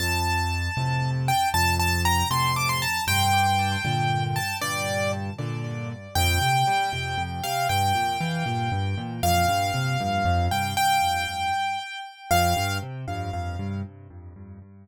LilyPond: <<
  \new Staff \with { instrumentName = "Acoustic Grand Piano" } { \time 6/8 \key f \major \tempo 4. = 78 a''2~ a''8 g''8 | a''8 a''8 bes''8 c'''8 d'''16 c'''16 a''8 | g''2~ g''8 a''8 | d''4 r2 |
g''2~ g''8 f''8 | g''2. | f''2~ f''8 g''8 | g''2. |
f''4 r2 | }
  \new Staff \with { instrumentName = "Acoustic Grand Piano" } { \clef bass \time 6/8 \key f \major f,4. <a, c>4. | f,4. <a, c>4. | g,4. <bes, d>4. | g,4. <bes, d>4. |
f,8 c8 g8 c8 f,8 c8 | g,8 bes,8 e8 bes,8 g,8 bes,8 | f,8 g,8 c8 g,8 f,8 g,8 | r2. |
f,8 g,8 c8 g,8 f,8 g,8 | }
>>